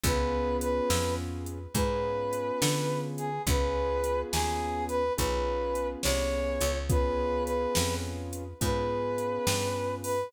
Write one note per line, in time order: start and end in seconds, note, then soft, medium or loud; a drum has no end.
0.04 0.81 C#2 medium
0.04 1.59 B3 loud
0.04 1.59 C#4 medium
0.04 1.59 F4 medium
0.04 1.59 G#4 medium
0.04 0.57 B4 medium
0.04 kick loud
0.04 closed hi-hat loud
0.61 1.14 B4 medium
0.61 closed hi-hat loud
0.90 1.67 F2 medium
0.90 snare loud
1.46 closed hi-hat medium
1.75 2.52 G#2 medium
1.75 3.29 B3 medium
1.75 3.29 C#4 medium
1.75 3.29 F4 medium
1.75 3.29 G#4 medium
1.75 3.00 B4 medium
1.75 kick loud
1.75 closed hi-hat loud
2.33 closed hi-hat medium
2.62 3.39 D3 medium
2.62 snare loud
3.18 3.42 G#4 medium
3.18 closed hi-hat medium
3.47 4.24 C#2 medium
3.47 5.02 B3 medium
3.47 5.02 C#4 medium
3.47 5.02 F4 medium
3.47 5.02 G#4 loud
3.47 4.20 B4 medium
3.47 kick loud
3.47 closed hi-hat loud
4.04 closed hi-hat medium
4.32 5.10 D#2 medium
4.32 4.85 G#4 medium
4.32 snare loud
4.89 5.13 B4 medium
4.89 closed hi-hat medium
5.17 5.96 B1 medium
5.17 6.72 B3 medium
5.17 6.72 C#4 medium
5.17 6.72 F4 medium
5.17 6.72 G#4 medium
5.17 5.87 B4 medium
5.17 kick loud
5.17 closed hi-hat loud
5.75 closed hi-hat medium
6.03 6.59 C2 medium
6.03 6.78 C#5 medium
6.03 snare loud
6.61 7.67 C#2 medium
6.61 closed hi-hat medium
6.90 8.44 B3 medium
6.90 8.44 C#4 medium
6.90 8.44 F4 loud
6.90 8.44 G#4 medium
6.90 7.43 B4 medium
6.90 kick loud
6.90 closed hi-hat loud
7.45 7.95 B4 medium
7.45 closed hi-hat medium
7.75 8.54 F2 medium
7.75 snare loud
8.33 closed hi-hat medium
8.61 9.39 G#2 medium
8.61 10.15 B3 medium
8.61 10.15 C#4 medium
8.61 10.15 F4 medium
8.61 10.15 G#4 medium
8.61 9.95 B4 medium
8.61 kick loud
8.61 closed hi-hat loud
9.18 closed hi-hat medium
9.47 10.24 G2 medium
9.47 snare loud
10.04 10.32 B4 medium
10.04 open hi-hat medium